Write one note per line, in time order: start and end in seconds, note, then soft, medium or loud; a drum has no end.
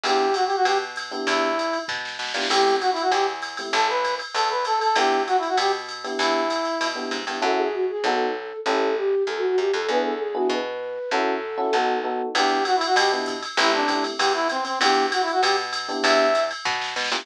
0.04 0.53 E2 medium
0.04 0.26 B3 medium
0.04 0.26 D4 medium
0.04 0.26 E4 medium
0.04 0.26 G4 medium
0.04 0.35 G4 medium
0.04 ride medium
0.34 0.45 F#4 medium
0.34 hi-hat pedal medium
0.34 ride medium
0.46 0.56 G4 medium
0.46 ride medium
0.56 0.66 F#4 medium
0.65 1.14 B2 medium
0.65 0.78 G4 medium
0.65 ride medium
0.96 hi-hat pedal medium
0.96 ride medium
1.11 1.48 B3 medium
1.11 1.48 D4 medium
1.11 1.48 E4 medium
1.11 1.48 G4 medium
1.11 ride medium
1.27 1.76 E2 loud
1.27 1.79 E4 medium
1.27 kick medium
1.27 ride medium
1.59 hi-hat pedal medium
1.59 ride medium
1.73 ride medium
1.88 2.18 B2 medium
1.88 kick medium
1.88 snare medium
2.05 snare medium
2.19 2.33 B2 medium
2.19 snare medium
2.27 snare medium
2.34 2.48 A#2 medium
2.34 2.46 B3 medium
2.34 2.46 D4 medium
2.34 2.46 E4 medium
2.34 2.46 G4 medium
2.34 snare medium
2.42 snare medium
2.50 2.99 A1 loud
2.50 2.71 A3 medium
2.50 2.71 C4 medium
2.50 2.71 E4 medium
2.50 2.71 G4 medium
2.50 2.76 G4 medium
2.50 crash medium
2.50 ride medium
2.81 2.90 F#4 medium
2.81 hi-hat pedal medium
2.81 ride medium
2.92 3.02 E4 medium
2.92 ride medium
3.01 3.11 F#4 medium
3.11 3.61 E2 medium
3.11 3.26 G4 medium
3.11 kick soft
3.11 ride medium
3.42 hi-hat pedal medium
3.42 ride medium
3.57 3.70 A3 medium
3.57 3.70 C4 medium
3.57 3.70 E4 medium
3.57 3.70 G4 medium
3.57 ride medium
3.73 4.22 A1 loud
3.73 3.87 A4 medium
3.73 kick medium
3.73 ride medium
3.89 4.15 B4 medium
4.04 kick medium
4.04 hi-hat pedal medium
4.04 ride medium
4.19 ride medium
4.34 4.84 E2 medium
4.34 4.49 A4 medium
4.34 ride medium
4.50 4.65 B4 medium
4.65 4.79 A4 medium
4.65 hi-hat pedal medium
4.65 ride medium
4.81 4.96 A4 medium
4.81 ride medium
4.96 5.45 E2 medium
4.96 5.18 B3 medium
4.96 5.18 D4 medium
4.96 5.18 E4 medium
4.96 5.18 G4 medium
4.96 5.23 G4 medium
4.96 ride medium
5.27 5.37 F#4 medium
5.27 hi-hat pedal medium
5.27 ride medium
5.38 5.48 E4 medium
5.43 ride medium
5.48 5.58 F#4 medium
5.57 6.07 B2 medium
5.57 5.72 G4 medium
5.57 ride medium
5.89 hi-hat pedal medium
5.89 ride medium
6.04 6.41 B3 medium
6.04 6.41 D4 medium
6.04 6.41 E4 medium
6.04 6.41 G4 medium
6.04 ride medium
6.19 6.68 E2 loud
6.19 6.87 E4 medium
6.19 kick medium
6.19 ride medium
6.50 kick soft
6.50 hi-hat pedal medium
6.50 ride medium
6.65 ride medium
6.81 7.10 B2 medium
6.81 ride medium
6.95 7.17 B3 medium
6.95 7.17 D4 medium
6.95 7.17 E4 medium
6.95 7.17 G4 medium
7.11 7.25 G#2 medium
7.11 kick soft
7.11 hi-hat pedal medium
7.11 ride medium
7.27 7.41 G2 medium
7.27 7.38 B3 medium
7.27 7.38 D4 medium
7.27 7.38 E4 medium
7.27 7.38 G4 medium
7.27 ride medium
7.42 7.92 F#2 medium
7.42 7.63 C#4 medium
7.42 7.63 E4 loud
7.42 7.63 F#4 loud
7.42 7.63 A4 loud
7.42 7.58 A4 medium
7.57 7.71 G#4 medium
7.73 7.85 F#4 medium
7.89 8.03 G#4 medium
8.04 8.53 B1 medium
8.04 8.26 B3 loud
8.04 8.26 D#4 loud
8.04 8.26 F#4 loud
8.04 8.56 A4 medium
8.04 8.26 A4 loud
8.66 9.15 A1 medium
8.66 8.88 C#4 loud
8.66 8.88 E4 medium
8.66 8.88 G4 loud
8.66 8.92 A4 loud
8.66 8.88 A4 loud
8.96 9.23 G4 medium
9.27 9.56 E2 medium
9.27 9.37 A4 medium
9.37 9.47 F#4 medium
9.48 9.58 F#4 medium
9.58 9.72 F#2 medium
9.58 9.71 G4 medium
9.73 9.87 F2 medium
9.73 9.86 A4 medium
9.88 10.38 E2 medium
9.88 10.11 B3 loud
9.88 10.11 D4 medium
9.88 10.11 E4 loud
9.88 10.11 G#4 loud
9.88 10.02 B4 loud
10.05 10.19 A4 medium
10.20 10.34 G#4 medium
10.34 10.56 B3 medium
10.34 10.56 D4 medium
10.34 10.56 E4 medium
10.34 10.48 F#4 medium
10.34 10.56 G#4 medium
10.50 10.99 B2 medium
10.50 11.10 B4 medium
11.11 11.61 F#2 medium
11.11 11.33 C#4 loud
11.11 11.33 E4 loud
11.11 11.33 F#4 loud
11.11 11.70 A4 loud
11.11 11.33 A4 loud
11.57 11.68 C#4 medium
11.57 11.68 E4 medium
11.57 11.68 F#4 medium
11.57 11.68 A4 medium
11.73 12.22 B1 medium
11.73 11.96 B3 loud
11.73 11.96 D#4 loud
11.73 11.96 F#4 loud
11.73 11.96 A4 loud
12.04 12.25 B3 medium
12.04 12.25 D#4 medium
12.04 12.25 F#4 medium
12.04 12.25 A4 medium
12.35 12.84 E2 loud
12.35 12.57 B3 medium
12.35 12.57 D4 loud
12.35 12.57 E4 loud
12.35 12.64 G4 medium
12.35 12.57 G4 medium
12.35 ride medium
12.65 12.76 F#4 medium
12.65 hi-hat pedal medium
12.65 ride medium
12.76 12.85 E4 medium
12.81 ride medium
12.86 12.96 F#4 medium
12.96 13.45 B2 loud
12.96 13.12 G4 medium
12.96 kick soft
12.96 ride loud
13.12 13.34 B3 medium
13.12 13.34 D4 medium
13.12 13.34 E4 medium
13.12 13.34 G4 medium
13.26 kick medium
13.26 hi-hat pedal medium
13.26 ride medium
13.42 ride medium
13.57 14.07 A1 loud
13.57 13.80 A3 medium
13.57 13.80 C4 medium
13.57 13.80 E4 medium
13.57 13.71 E4 medium
13.57 13.80 G4 medium
13.57 ride medium
13.74 14.04 D4 medium
13.88 14.10 A3 medium
13.88 14.10 C4 medium
13.88 14.10 E4 medium
13.88 14.10 G4 medium
13.88 kick medium
13.88 hi-hat pedal medium
13.88 ride medium
14.04 ride medium
14.18 14.68 E2 medium
14.18 14.33 G4 medium
14.18 kick medium
14.18 ride loud
14.34 14.48 E4 medium
14.49 14.64 C4 medium
14.49 hi-hat pedal medium
14.49 ride medium
14.65 14.79 C4 medium
14.65 ride medium
14.81 15.30 E2 loud
14.81 15.04 B3 medium
14.81 15.04 D4 medium
14.81 15.04 E4 medium
14.81 15.06 G4 medium
14.81 15.04 G4 loud
14.81 ride loud
15.12 15.22 F#4 medium
15.12 hi-hat pedal medium
15.12 ride medium
15.22 15.32 E4 medium
15.28 ride medium
15.32 15.42 F#4 medium
15.42 15.92 B2 medium
15.42 15.56 G4 medium
15.42 ride loud
15.73 hi-hat pedal medium
15.73 ride medium
15.88 16.25 B3 medium
15.88 16.25 D4 loud
15.88 16.25 E4 medium
15.88 16.25 G4 medium
15.88 ride medium
16.03 16.53 E2 loud
16.03 16.43 E5 medium
16.03 kick medium
16.03 ride loud
16.35 hi-hat pedal medium
16.35 ride medium
16.51 ride medium
16.65 16.95 B2 loud
16.65 kick medium
16.65 snare medium
16.81 snare medium
16.96 17.10 B2 medium
16.96 snare medium
17.04 snare medium
17.12 17.25 A#2 loud
17.12 17.22 B3 medium
17.12 17.22 D4 medium
17.12 17.22 E4 medium
17.12 17.22 G4 medium
17.12 snare medium
17.20 snare medium